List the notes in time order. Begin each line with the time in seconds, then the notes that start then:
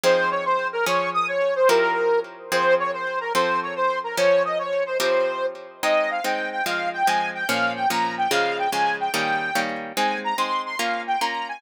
0.03 F3 C4 D#4 G#4 C5
0.31 C#5
0.45 C5
0.73 A#4
0.86 F3 C#4 G#4 C#5
1.14 D#6
1.28 C#5
1.55 C5
1.69 F3 C4 E4 G4 A#4
2.52 F3 C4 G#4 C5
2.80 C#5
2.93 C5
3.21 A#4
3.35 F3 C4 A4 C5
3.62 C#5
3.76 C5
4.04 A#4
4.17 F3 C#4 A#4 C#5
4.45 D#5
4.59 C#5
4.86 C5
5.00 F3 C4 E4 G4 A#4 C5
5.83 G#3 C4 D#4 D#5
6.11 F5
6.24 G#3 C4 D#4 G5
6.52 G5
6.66 F3 G#3 C4 F5
6.93 G5
7.07 F3 G#3 C4 G#5
7.34 G5
7.48 A#2 F3 C#4 F5
7.76 G5
7.89 A#2 F3 C#4 A#5
8.18 G5
8.31 C#3 F3 G#3 F5
8.58 G5
8.72 C#3 F3 G#3 G#5
9.00 G5
9.14 D#3 G3 A#3 C#4 G5
9.55 D#3 G3 A#3 C#4
9.97 G#3 C4 D#4 G#5
10.24 A#5
10.38 G#3 C4 D#4 C6
10.66 C6
10.79 A#3 C#4 F4 F5
11.07 G5
11.21 A#3 C#4 F4 A#5
11.49 G#5